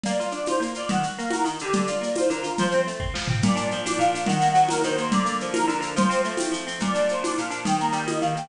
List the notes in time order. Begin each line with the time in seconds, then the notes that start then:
0.04 A#3 D5, low conga, shaker
0.20 F4, shaker
0.31 D4 D5, shaker
0.46 F4 C5, tambourine, high conga, shaker
0.60 A#3, shaker
0.74 F4 D5, shaker
0.89 D#3 F#5, low conga, shaker
1.03 F#4, shaker
1.18 A#3 F5, shaker
1.30 F#4 A#4, tambourine, high conga, shaker
1.44 D#3, shaker
1.59 D3 G4, shaker
1.73 D5, low conga, shaker
1.87 F4, shaker
2.01 A#3, shaker
2.15 F4 C5, tambourine, high conga, shaker
2.28 D3 A#4, shaker
2.43 F4 A#4, shaker
2.58 F3 C5, low conga, shaker
2.71 C4, shaker
2.87 A3, shaker
3.00 C4, kick
3.14 F3, snare
3.28 C4, floor tom
3.42 A#2 D5, low conga, shaker
3.55 D4, shaker
3.71 F3, shaker
3.85 D4 D5, tambourine, high conga, shaker
3.98 A#2 F5, shaker
4.14 D4, shaker
4.26 D#3 F#5, low conga, shaker
4.41 A#3, shaker
4.55 F#3, shaker
4.68 A#3 A#4, tambourine, high conga, shaker
4.83 D#3 C5, shaker
4.97 A#3 C5, shaker
5.11 D3 D5, low conga, shaker
5.25 A#3, shaker
5.40 F3, shaker
5.53 A#3 A#4, tambourine, high conga, shaker
5.68 D3 A#4, shaker
5.80 A#3, shaker
5.96 F3 C5, low conga, shaker
6.09 C4, shaker
6.24 A3, shaker
6.37 C4, tambourine, high conga, shaker
6.52 F3, shaker
6.67 C4, shaker
6.80 A#2 D5, low conga, shaker
6.94 D4, shaker
7.09 F3 C5, shaker
7.22 D4 D5, tambourine, high conga, shaker
7.37 A#2 F5, shaker
7.50 D4, shaker
7.65 D#3 G5, low conga, shaker
7.80 A#3 A#5, shaker
7.92 G3 G5, shaker
8.06 A#3 D#5, tambourine, high conga, shaker
8.21 D#3 F5, shaker
8.35 A#3 G5, shaker